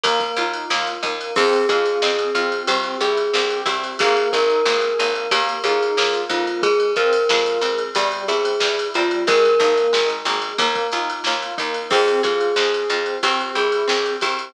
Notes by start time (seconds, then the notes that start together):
0.03 D#2 A#3, kick, ride
0.20 kick, ride
0.36 D#2 D#4 F4, ride
0.53 ride
0.70 D#2 A#3 F4, snare
0.87 ride
1.03 D#2 A#3 D#4, kick, ride
1.21 ride
1.36 F2 C4 G#4, kick, crash
1.53 ride
1.69 F2 F4 G#4, kick, ride
1.85 ride
2.02 F2 C4 G#4, snare
2.19 ride
2.35 F2 C4 F4, ride
2.52 ride
2.67 C2 C4 G4, kick, ride
2.83 ride
3.00 C2 E4 G4 G#4, ride
3.17 ride
3.33 C2 C4 G4, snare
3.50 ride
3.66 C2 C4 E4 G4, kick, ride
3.84 ride
3.99 G#1 A#3 G#4, kick, ride
4.17 ride
4.32 G#1 D#4 G#4 A#4, kick, ride
4.50 ride
4.65 G#1 A#3 G#4, snare
4.81 ride
4.99 G#1 A#3 D#4, ride
5.15 ride
5.31 D#2 A#3 G4, kick, ride
5.49 ride
5.63 D#2 D#4 F4 G#4, ride
5.83 ride
5.97 D#2 A#3 F4, snare
6.14 ride
6.29 F2 A#3 D#4 F4, kick, ride
6.47 ride
6.62 G#3 G#4, kick, ride
6.80 ride
6.96 F2 C4 F4 A#4, kick, ride
7.13 ride
7.29 F2 G#3 F4, snare
7.46 ride
7.61 F2 G#3 C4, ride
7.78 ride
7.95 E2 G3 G4, kick, ride
8.12 ride
8.28 E2 C4 E4 G#4, ride
8.45 ride
8.60 E2 G3 E4, snare
8.79 ride
8.94 E2 G3 C4 F4, ride
9.11 ride
9.27 G#1 G#3 A#4, kick, ride
9.45 ride
9.59 G#1 A#3 D#4, kick, ride
9.77 ride
9.93 G#1 G#3 D#4, snare
10.09 ride
10.25 G#1 G#3 A#3, ride
10.42 ride
10.58 D#2 A#3, kick, ride
10.75 kick, ride
10.92 D#2 D#4 F4, ride
11.09 ride
11.24 D#2 A#3 F4, snare
11.42 ride
11.58 D#2 A#3 D#4, kick, ride
11.74 ride
11.90 F2 C4 G#4, kick, crash
12.08 ride
12.23 F2 F4 G#4, kick, ride
12.41 ride
12.56 F2 C4 G#4, snare
12.74 ride
12.89 F2 C4 F4, ride
13.06 ride
13.23 C2 C4 G4, kick, ride
13.40 ride
13.55 C2 E4 G4 G#4, ride
13.72 ride
13.88 C2 C4 G4, snare
14.06 ride
14.21 C2 C4 E4 G4, kick, ride
14.39 ride